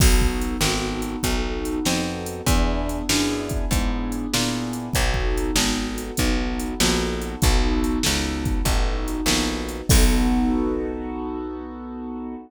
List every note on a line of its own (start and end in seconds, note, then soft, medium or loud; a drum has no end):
0.00 0.57 B1 medium
0.00 0.56 B3 medium
0.00 0.56 D#4 medium
0.00 0.56 F#4 medium
0.00 0.56 A4 medium
0.00 kick loud
0.00 crash loud
0.21 kick medium
0.41 closed hi-hat medium
0.61 1.16 G#1 medium
0.61 1.18 B3 medium
0.61 1.18 D#4 medium
0.61 1.18 F#4 medium
0.61 1.18 A4 medium
0.61 snare loud
1.02 closed hi-hat medium
1.23 1.79 B1 medium
1.23 1.79 B3 medium
1.23 1.79 D#4 medium
1.23 1.79 F#4 medium
1.23 1.79 A4 medium
1.23 kick medium
1.23 closed hi-hat medium
1.65 closed hi-hat medium
1.85 2.42 F2 medium
1.85 2.41 B3 medium
1.85 2.41 D#4 medium
1.85 2.41 F#4 medium
1.85 2.41 A4 medium
1.85 snare medium
2.26 closed hi-hat medium
2.47 3.02 E2 medium
2.47 3.03 B3 medium
2.47 3.03 D4 medium
2.47 3.03 E4 loud
2.47 3.03 G#4 medium
2.47 kick medium
2.47 closed hi-hat loud
2.89 closed hi-hat medium
3.09 3.65 F#2 medium
3.09 3.65 B3 medium
3.09 3.65 D4 medium
3.09 3.65 E4 medium
3.09 3.65 G#4 medium
3.09 snare loud
3.49 kick medium
3.49 closed hi-hat medium
3.71 4.26 G#2 medium
3.71 4.27 B3 medium
3.71 4.27 D4 medium
3.71 4.27 E4 medium
3.71 4.27 G#4 medium
3.71 kick medium
3.71 closed hi-hat medium
4.12 closed hi-hat medium
4.33 4.90 A#2 medium
4.33 4.89 B3 medium
4.33 4.89 D4 medium
4.33 4.89 E4 medium
4.33 4.89 G#4 medium
4.33 snare loud
4.73 closed hi-hat medium
4.93 5.51 B1 medium
4.93 5.51 B3 medium
4.93 5.51 D#4 medium
4.93 5.51 F#4 medium
4.93 5.51 A4 medium
4.93 kick medium
4.93 closed hi-hat medium
5.14 kick medium
5.38 closed hi-hat medium
5.56 6.11 G#1 medium
5.56 6.12 B3 medium
5.56 6.12 D#4 medium
5.56 6.12 F#4 medium
5.56 6.12 A4 medium
5.56 snare loud
5.98 closed hi-hat medium
6.17 6.74 B1 medium
6.17 6.74 B3 medium
6.17 6.74 D#4 medium
6.17 6.74 F#4 medium
6.17 6.74 A4 medium
6.17 kick medium
6.17 closed hi-hat medium
6.60 closed hi-hat medium
6.80 7.36 A#1 medium
6.80 7.36 B3 medium
6.80 7.36 D#4 medium
6.80 7.36 F#4 medium
6.80 7.36 A4 medium
6.80 snare loud
7.22 closed hi-hat medium
7.42 7.99 B1 medium
7.42 7.98 B3 medium
7.42 7.98 D#4 medium
7.42 7.98 F#4 medium
7.42 7.98 A4 medium
7.42 kick loud
7.42 closed hi-hat medium
7.84 closed hi-hat medium
8.03 8.62 C#2 medium
8.03 8.60 B3 medium
8.03 8.60 D#4 medium
8.03 8.60 F#4 medium
8.03 8.60 A4 medium
8.03 snare loud
8.45 kick medium
8.45 closed hi-hat medium
8.65 9.21 A1 medium
8.65 9.22 B3 medium
8.65 9.22 D#4 medium
8.65 9.22 F#4 medium
8.65 9.22 A4 medium
8.65 kick medium
8.65 closed hi-hat medium
9.08 closed hi-hat medium
9.26 9.82 A#1 medium
9.26 9.84 B3 medium
9.26 9.84 D#4 medium
9.26 9.84 F#4 medium
9.26 9.84 A4 medium
9.26 snare loud
9.69 closed hi-hat medium
9.89 12.36 B1 medium
9.89 12.35 B3 loud
9.89 12.35 D#4 medium
9.89 12.35 F#4 loud
9.89 12.35 A4 loud
9.89 kick loud
9.89 crash loud